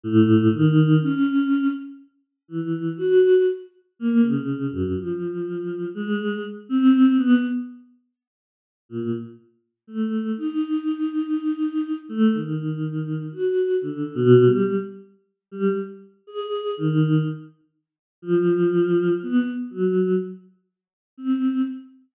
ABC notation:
X:1
M:5/8
L:1/16
Q:1/4=61
K:none
V:1 name="Choir Aahs"
A,,2 ^D,2 ^C3 z3 | E,2 ^F2 z2 ^A, ^C,2 ^F,, | F,4 ^G,2 z C2 B, | z6 ^A,, z3 |
A,2 ^D7 A, | ^D,4 ^F2 (3=D,2 B,,2 G,2 | z3 G, z2 ^G2 ^D,2 | z4 F,4 B, z |
^F,2 z4 C2 z2 |]